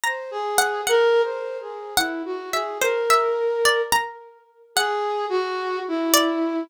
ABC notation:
X:1
M:7/8
L:1/8
Q:1/4=108
K:none
V:1 name="Flute"
c ^G2 | (3^A2 c2 ^G2 E ^F G | ^A4 z3 | ^G2 ^F2 E3 |]
V:2 name="Harpsichord"
^a2 ^f | ^f z3 f z e | c e2 d ^a3 | ^f4 z d2 |]